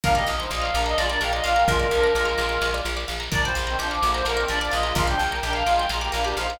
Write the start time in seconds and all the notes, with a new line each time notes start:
0.04 A#1 D4 A#4 F5, kick, snare
0.15 A#3 G4 D5 D#5, snare
0.27 A#1 F5, snare
0.39 D#4 C5 A#5, snare
0.50 A#1 F4 D5 D#5 D6, snare
0.61 F5 F6, snare
0.74 A#1 D4 A#4 D6, snare
0.86 D#5 A#5, snare
0.98 A#1 G#3 F4 D5 F5, snare
1.09 D4 A#4 D5, snare
1.21 A#1 A#4 F5 G5, snare
1.33 F4 D5 D#5, snare
1.43 A#1 F4 D5 F5, snare
1.56 A#4 G5 A#5, snare
1.66 A#1 G#3 F4 A#4, kick, snare
1.79 D5, snare
1.91 A#1 F3 D4 F5, snare
2.03 A#5, snare
2.15 A#1 G#3 F4 D6, snare
2.25 F6, snare
2.38 A#1 D6, snare
2.49 A#5, snare
2.61 A#1 F5, snare
2.73 D5, snare
2.85 A#1 A#4, snare
2.97 D5, snare
3.08 A#1 F5, snare
3.20 A#5, snare
3.32 A#1 D4 A#4 D5, kick, snare
3.44 A#2 G3 C5 D5, snare
3.55 A#1 F5, snare
3.67 D#3 C4 A#5, snare
3.79 A#1 F3 D4 C5 D6, snare
3.91 D6 F6, snare
4.02 A#1 D3 A#3 D6, snare
4.14 C5 A#5, snare
4.25 A#1 D3 A#3 A#4 F5, snare
4.37 D#3 C4 D5, snare
4.48 A#1 F3 D4 A#4 D5, snare
4.60 F3 D4 D5, snare
4.71 A#1 G#3 F4 D#5 F5, snare
4.83 G#3 F4 A#5, snare
4.95 A#1 G#3 F4 A#4 F5, kick, snare
5.07 F3 D4 D5 G5, snare
5.19 A#1 F5, snare
5.31 A#4 G5 A#5, snare
5.43 A#1 D4 A#4 G5 D6, snare
5.53 F5 F6, snare
5.66 A#1 G#3 F4 D6, snare
5.78 G5 A#5, snare
5.89 A#1 G#3 F4 F5 A#5, snare
6.01 A#3 G4 D5, snare
6.12 A#1 D4 A#4 F5, snare
6.24 D4 G4 A#4 D5, snare
6.36 A#1 D#4 C5 F5, snare
6.49 D#4 C5 A#5, snare